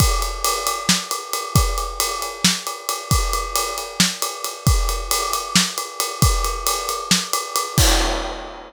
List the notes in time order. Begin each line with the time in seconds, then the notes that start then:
0.00 kick, ride
0.22 ride
0.44 ride
0.67 ride
0.89 snare
1.11 ride
1.33 ride
1.56 kick, ride
1.78 ride
2.00 ride
2.22 ride
2.44 snare
2.67 ride
2.89 ride
3.11 kick, ride
3.33 ride
3.56 ride
3.78 ride
4.00 snare
4.22 ride
4.44 ride
4.67 kick, ride
4.89 ride
5.11 ride
5.33 ride
5.56 snare
5.78 ride
6.00 ride
6.22 kick, ride
6.44 ride
6.67 ride
6.89 ride
7.11 snare
7.33 ride
7.56 ride
7.78 kick, crash